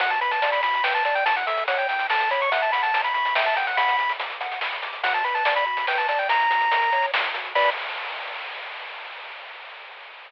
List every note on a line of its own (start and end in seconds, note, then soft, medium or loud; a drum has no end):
0.00 1.00 B1 loud
0.00 0.19 F#4 loud
0.00 0.10 F#5 medium
0.00 kick loud
0.00 closed hi-hat loud
0.10 0.20 A5 medium
0.10 closed hi-hat medium
0.21 0.40 B4 medium
0.21 0.31 B5 medium
0.21 closed hi-hat medium
0.31 0.51 A5 medium
0.31 closed hi-hat loud
0.42 0.61 D5 medium
0.42 closed hi-hat loud
0.52 0.62 B5 medium
0.52 closed hi-hat medium
0.63 0.82 F#4 medium
0.63 0.83 B5 medium
0.63 closed hi-hat loud
0.74 closed hi-hat medium
0.84 1.03 B4 medium
0.84 0.94 G5 medium
0.84 snare loud
0.95 1.04 A5 medium
0.95 closed hi-hat medium
1.05 2.44 A1 medium
1.05 1.24 D5 medium
1.05 1.15 A5 medium
1.05 closed hi-hat medium
1.15 1.25 G5 medium
1.15 closed hi-hat medium
1.26 1.45 E4 loud
1.26 1.36 A5 medium
1.26 kick loud
1.26 closed hi-hat loud
1.36 1.46 F#5 medium
1.36 closed hi-hat medium
1.47 1.66 A4 medium
1.47 1.64 E5 medium
1.47 closed hi-hat loud
1.57 closed hi-hat medium
1.68 1.87 C#5 loud
1.68 1.78 F#5 medium
1.68 closed hi-hat loud
1.78 1.88 G5 medium
1.78 closed hi-hat medium
1.89 2.08 E4 medium
1.89 2.07 G5 medium
1.89 closed hi-hat medium
1.99 closed hi-hat medium
2.10 2.29 A4 medium
2.10 2.30 A5 medium
2.10 snare loud
2.20 closed hi-hat medium
2.31 2.50 C#5 loud
2.31 2.41 B5 medium
2.31 closed hi-hat medium
2.41 2.52 C#6 medium
2.41 closed hi-hat medium
2.51 3.67 F#2 medium
2.51 2.70 E5 loud
2.51 2.62 F#5 medium
2.51 kick loud
2.51 closed hi-hat loud
2.62 2.72 A5 medium
2.62 closed hi-hat medium
2.72 2.92 F#5 medium
2.72 2.82 B5 medium
2.72 closed hi-hat loud
2.83 3.01 A5 medium
2.83 closed hi-hat medium
2.94 3.13 A#5 medium
2.94 closed hi-hat loud
3.04 3.14 B5 medium
3.04 closed hi-hat medium
3.14 3.35 B5 medium
3.14 3.34 C#6 loud
3.14 closed hi-hat medium
3.25 closed hi-hat medium
3.35 3.54 E5 loud
3.35 3.45 G5 medium
3.35 snare loud
3.46 3.56 A5 medium
3.46 closed hi-hat medium
3.56 3.76 F#5 medium
3.56 3.67 G5 medium
3.56 closed hi-hat loud
3.67 3.77 F#5 medium
3.67 closed hi-hat medium
3.77 4.94 B1 medium
3.77 3.97 F#5 loud
3.77 4.13 B5 medium
3.77 kick loud
3.77 closed hi-hat loud
3.88 closed hi-hat medium
3.99 4.17 B5 medium
3.99 closed hi-hat medium
4.09 closed hi-hat medium
4.19 4.38 D6 medium
4.19 closed hi-hat loud
4.30 closed hi-hat medium
4.41 4.59 F#5 medium
4.41 closed hi-hat medium
4.51 closed hi-hat medium
4.61 4.81 B5 medium
4.61 snare loud
4.72 closed hi-hat medium
4.82 5.01 D6 medium
4.82 closed hi-hat medium
4.93 closed hi-hat medium
5.03 6.19 B1 medium
5.03 5.23 F#4 loud
5.03 5.13 F#5 medium
5.03 kick loud
5.03 closed hi-hat loud
5.14 5.24 A5 medium
5.14 kick medium
5.14 closed hi-hat medium
5.24 5.44 B4 medium
5.24 5.34 B5 medium
5.24 closed hi-hat medium
5.35 5.54 A5 medium
5.35 closed hi-hat medium
5.45 5.64 D5 medium
5.45 closed hi-hat loud
5.56 5.66 B5 medium
5.56 closed hi-hat medium
5.66 5.85 F#4 medium
5.66 5.87 B5 medium
5.77 closed hi-hat medium
5.87 6.06 B4 medium
5.87 5.98 G5 medium
5.87 snare loud
5.98 6.08 A5 medium
5.98 closed hi-hat medium
6.08 6.27 D5 medium
6.08 6.19 A5 medium
6.08 closed hi-hat loud
6.19 6.29 G5 medium
6.19 closed hi-hat medium
6.29 7.10 F#2 medium
6.29 6.48 E4 loud
6.29 7.06 A#5 loud
6.29 kick loud
6.29 closed hi-hat loud
6.40 closed hi-hat medium
6.50 6.69 F#4 medium
6.50 closed hi-hat loud
6.61 closed hi-hat medium
6.71 6.90 A#4 medium
6.71 closed hi-hat loud
6.82 closed hi-hat medium
6.92 7.11 C#5 medium
6.92 closed hi-hat medium
7.02 closed hi-hat medium
7.12 7.31 A2 medium
7.12 7.32 E4 medium
7.12 snare loud
7.24 closed hi-hat medium
7.33 7.52 A#2 medium
7.33 7.53 F#4 medium
7.33 closed hi-hat loud
7.45 closed hi-hat medium
7.55 7.70 B1 loud
7.55 7.70 F#4 loud
7.55 7.70 B4 loud
7.55 7.70 D5 loud
7.55 7.70 B5 loud
7.55 kick loud
7.55 crash loud